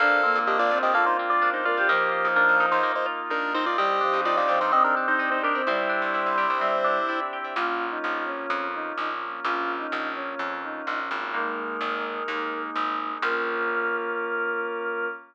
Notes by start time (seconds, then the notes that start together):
0.00 A#1 A#3 C4 D4 F4 A4 A#4 C5 D5 F5
0.23 A#3 C4
0.35 A#2
0.47 D4 G4 A#4 C5 D5 D#5 F5
0.59 A#1 F4 D5
0.71 A#1 C4 F4 A#4 C5 D5 F5
0.82 A#1 G4 A#4 C5 D5 D#5 F5
0.94 A#3 F4 A4 A#4 C5 D5 F5
1.06 D#4 C5
1.19 C4
1.30 F4 D5
1.42 D4 A#4 C5 D5 F5
1.54 D#4 C5
1.65 F4 A#4 D5
1.77 G4 A#4 C5 D5 F5
1.88 D#2 F3 A#3 D#4 F4 G4 A#4 D#5 F5
2.12 F4
2.25 D#2
2.36 A#3 D4 A#4 D#5 F5
2.49 D#2
2.60 A#2 D#4 A#4 D#5 F5
2.71 D#2 D#4 A#4 C5 D#5 F5
2.83 A#3 A#4 D#5 F5
2.95 D#4 C5
3.06 F4
3.30 D4 D#4 A#4 D#5 F5
3.54 C4 D#4 C5
3.66 F4 A#4 D5 D#5 F5
3.77 C2 G3 C4 D4 D#4 G4 C5 D5 D#5 G5
4.01 F3 D4
4.13 C2
4.25 D#4 F4 C5 D5 D#5 G5
4.37 C2 F4 D5
4.48 C2 F3 G4 C5 D5 D#5 G5
4.61 G2 D#4 C5 D5 D#5 G5
4.72 C4 G4 C5 D5 D#5 G5
4.84 D4 A#4
4.97 D4
5.08 D#4 C5
5.19 D#4 C5 D5 D#5 G5
5.31 D#4 C5
5.43 D4 G4 A#4
5.55 C4 C5 D5 D#5 G5
5.67 C2 G3 C4 D4 E4 G4 C5 D5 E5 G5
5.89 D4
6.02 C2
6.14 E4 C5 D5 E5 G5
6.26 C2
6.38 C2 G4 C5 D5 E5 G5
6.50 C2 C5 D5 E5 G5
6.60 G3 C4 C5 D5 E5 G5
6.84 D4
7.09 E4 C5 D5 E5 G5
7.33 G4
7.44 C5 D5 E5 G5
7.56 A#1 A#3 C#4 F4
7.91 D#4
8.04 A#1
8.26 C#4
8.50 F2
8.74 D#4
8.98 A#1 D#4
9.44 A#1 A#3 C#4 F4
9.79 D#4
9.92 A#1
10.15 C#4
10.39 F2
10.63 D#4
10.87 A#1 D#4
11.11 G#1
11.33 G#3 A#3 D#4 A#4
11.81 G#1
12.28 D#2 G#3 A#3 D#4
12.75 G#1
13.22 A#1 A#3 C#4 F4 A#4